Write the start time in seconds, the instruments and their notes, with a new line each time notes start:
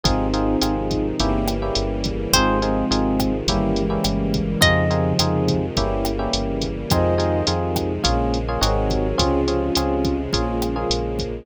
0.04 synth bass 1 G#1, string ensemble 1 C3 D#3 F3 G#3, electric piano 1 C4 D#4 F4 G#4, ocarina C4 D#4, kick, closed hi-hat
0.34 electric piano 1 C4 D#4 F4 G#4, closed hi-hat
0.62 synth bass 1 G#1, electric piano 1 C4 D#4 F4 G#4, cross-stick, closed hi-hat
0.91 ocarina C4 D#4, kick, closed hi-hat
1.20 synth bass 1 G1, string ensemble 1 C#3 E3 G3 A#3, electric piano 1 A#3 C#4 E4 G4, kick, closed hi-hat
1.48 cross-stick, closed hi-hat
1.62 electric piano 1 A#3 C#4 E4 G4
1.75 synth bass 1 G1, closed hi-hat
2.04 kick, closed hi-hat
2.33 synth bass 1 G#1, string ensemble 1 C3 D#3 F3 G#3, ocarina G#3 C4, electric piano 1 C4 D#4 F4 G#4, acoustic guitar (steel) C5, kick, cross-stick, closed hi-hat
2.62 ocarina G#3 C4, electric piano 1 C4 D#4 F4 G#4, closed hi-hat
2.91 synth bass 1 G#1, electric piano 1 C4 D#4 F4 G#4, closed hi-hat
3.20 kick, cross-stick, closed hi-hat
3.46 synth bass 1 G1, string ensemble 1 C#3 E3 G3 A#3, ocarina D#3 G3, electric piano 1 A#3 C#4 E4 G4, kick, closed hi-hat
3.76 ocarina E3 G#3, closed hi-hat
3.90 electric piano 1 A#3 C#4 E4 G4
4.04 synth bass 1 G1, cross-stick, closed hi-hat
4.34 kick, closed hi-hat
4.61 synth bass 1 F2, string ensemble 1 C3 D#3 F3 G#3, ocarina C#3 F3, electric piano 1 C4 D#4 F4 G#4, acoustic guitar (steel) D#5, kick, closed hi-hat
4.90 electric piano 1 C4 D#4 F4 G#4, closed hi-hat
5.19 synth bass 1 F2, electric piano 1 C4 D#4 F4 G#4, cross-stick, closed hi-hat
5.48 kick, closed hi-hat
5.77 synth bass 1 G1, string ensemble 1 C#3 E3 G3 A#3, electric piano 1 A#3 C#4 E4 G4, kick, closed hi-hat
6.05 cross-stick, closed hi-hat
6.19 electric piano 1 A#3 C#4 E4 G4
6.33 synth bass 1 G1, closed hi-hat
6.62 kick, closed hi-hat
6.90 synth bass 1 F2, string ensemble 1 C3 D#3 F3 G#3, electric piano 1 C4 D#4 F4 G#4, ocarina C5 D#5, kick, cross-stick, closed hi-hat
7.18 electric piano 1 C4 D#4 F4 G#4, closed hi-hat
7.47 synth bass 1 F2, electric piano 1 C4 D#4 F4 G#4, closed hi-hat
7.76 kick, cross-stick, closed hi-hat
8.04 synth bass 1 A#1, string ensemble 1 C#3 F3 G#3 A#3, electric piano 1 A#3 C#4 F4 G#4, kick, closed hi-hat
8.34 closed hi-hat
8.48 electric piano 1 A#3 C#4 F4 G#4
8.61 synth bass 1 G#1, string ensemble 1 C3 D#3 F#3 G#3, electric piano 1 C4 D#4 F#4 G#4, ocarina A#4 C#5, cross-stick, closed hi-hat
8.90 kick, closed hi-hat
9.18 synth bass 1 C#2, string ensemble 1 C3 C#3 F3 G#3, electric piano 1 C4 C#4 F4 G#4, ocarina C#4 F4, kick, closed hi-hat
9.48 electric piano 1 C4 C#4 F4 G#4, closed hi-hat
9.75 synth bass 1 C#2, electric piano 1 C4 C#4 F4 G#4, cross-stick, closed hi-hat
10.05 kick, closed hi-hat
10.33 synth bass 1 A#1, string ensemble 1 C#3 F3 G#3 A#3, electric piano 1 A#3 C#4 F4 G#4, ocarina C#4 F4, kick, closed hi-hat
10.48 ocarina C#4 F4
10.62 cross-stick, closed hi-hat
10.76 electric piano 1 A#3 C#4 F4 G#4, ocarina F4 G#4
10.90 synth bass 1 A#1, closed hi-hat
11.19 kick, closed hi-hat